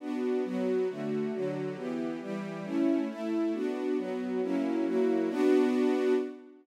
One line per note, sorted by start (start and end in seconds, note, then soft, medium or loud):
0.00 0.44 B3 medium
0.00 0.44 D4 medium
0.00 0.44 F#4 medium
0.44 0.88 F#3 medium
0.44 0.88 B3 medium
0.44 0.88 F#4 medium
0.88 1.32 D3 medium
0.88 1.32 A3 medium
0.88 1.32 F#4 medium
1.33 1.77 D3 medium
1.33 1.77 F#3 medium
1.33 1.77 F#4 medium
1.76 2.20 E3 medium
1.76 2.20 B3 medium
1.76 2.20 G4 medium
2.21 2.65 E3 medium
2.21 2.65 G3 medium
2.21 2.65 G4 medium
2.64 3.08 A3 medium
2.64 3.08 C#4 medium
2.64 3.08 E4 medium
3.09 3.53 A3 medium
3.09 3.53 E4 medium
3.09 3.53 A4 medium
3.53 3.97 B3 medium
3.53 3.97 D4 medium
3.53 3.97 F#4 medium
3.97 4.41 F#3 medium
3.97 4.41 B3 medium
3.97 4.41 F#4 medium
4.42 4.85 F#3 medium
4.42 4.85 A#3 medium
4.42 4.86 C#4 medium
4.42 4.85 E4 medium
4.86 5.29 F#3 medium
4.86 5.29 A#3 medium
4.86 5.29 E4 medium
4.86 5.29 F#4 medium
5.29 6.13 B3 loud
5.29 6.13 D4 loud
5.29 6.13 F#4 loud